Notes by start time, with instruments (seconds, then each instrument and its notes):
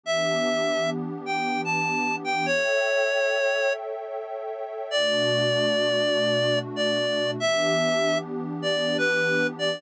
0.03 pad 2 (warm) E3 B3 D4 G4, clarinet E5
1.26 clarinet G5
1.65 clarinet A5
2.24 clarinet G5
2.46 pad 2 (warm) A4 C#5 E5 G5, clarinet C#5
4.91 pad 2 (warm) B2 A3 D4 F#4, clarinet D5
6.76 clarinet D5
7.38 pad 2 (warm) E3 B3 D4 G4, clarinet E5
8.62 clarinet D5
8.98 clarinet B4
9.59 clarinet D5